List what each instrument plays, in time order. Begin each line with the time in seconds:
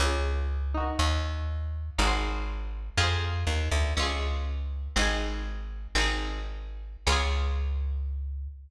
0.00 electric bass (finger) C#2, pizzicato strings C#4 F4
0.06 pizzicato strings G#4
0.74 pizzicato strings D#4 F#4
0.80 pizzicato strings A#4
0.99 electric bass (finger) D#2
1.98 electric bass (finger) G#1, pizzicato strings D#4 F#4
2.04 pizzicato strings G#4 C5
2.98 electric bass (finger) F2, pizzicato strings F4 G#4
3.03 pizzicato strings C5
3.47 electric bass (finger) D#2
3.71 electric bass (finger) D2
3.97 electric bass (finger) C#2, pizzicato strings C#4 F4
4.02 pizzicato strings G#4
4.96 electric bass (finger) G#1, pizzicato strings C4 D#4
5.02 pizzicato strings G#4
5.95 electric bass (finger) G#1, pizzicato strings C4 D#4
6.01 pizzicato strings G#4
7.07 electric bass (finger) C#2, pizzicato strings C#4 F4
7.12 pizzicato strings G#4